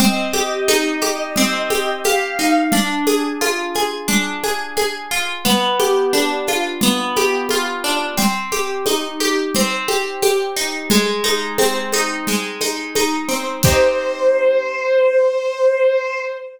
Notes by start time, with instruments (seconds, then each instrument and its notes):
0.00 orchestral harp C4, violin D#5, low conga, shaker
0.33 orchestral harp G4, high conga, shaker
0.68 orchestral harp D#4, high conga, shaker
1.01 orchestral harp G4, high conga, shaker
1.36 orchestral harp C4, low conga, shaker
1.70 orchestral harp G4, high conga, shaker
2.04 orchestral harp G4, violin F5, high conga, shaker
2.39 orchestral harp D#4, shaker
2.72 orchestral harp D4, low conga, shaker
3.07 orchestral harp G#4, high conga, shaker
3.41 orchestral harp F4, high conga, shaker
3.75 orchestral harp G#4, high conga, shaker
4.08 orchestral harp D4, low conga, shaker
4.43 orchestral harp G#4, high conga, shaker
4.77 orchestral harp G#4, high conga, shaker
5.11 orchestral harp F4, shaker
5.45 orchestral harp B3, low conga, shaker
5.79 orchestral harp G4, high conga, shaker
6.13 orchestral harp D4, high conga, shaker
6.47 orchestral harp F4, high conga, shaker
6.81 orchestral harp B3, low conga, shaker
7.16 orchestral harp G4, high conga, shaker
7.49 orchestral harp F4, high conga, shaker
7.84 orchestral harp D4, shaker
8.17 orchestral harp C4, low conga, shaker
8.52 orchestral harp G4, high conga, shaker
8.86 orchestral harp D#4, high conga, shaker
9.20 orchestral harp G4, high conga, shaker
9.54 orchestral harp C4, low conga, shaker
9.88 orchestral harp G4, high conga, shaker
10.22 orchestral harp G4, high conga, shaker
10.56 orchestral harp D#4, shaker
10.90 orchestral harp G#3, low conga, shaker
11.24 orchestral harp D#4, high conga, shaker
11.58 orchestral harp C4, high conga, shaker
11.92 orchestral harp D#4, high conga, shaker
12.27 orchestral harp G#3, low conga, shaker
12.61 orchestral harp D#4, high conga, shaker
12.95 orchestral harp D#4, high conga, shaker
13.29 orchestral harp C4, shaker
13.63 orchestral harp D#4 G4, violin C5, kick, crash
13.68 orchestral harp C4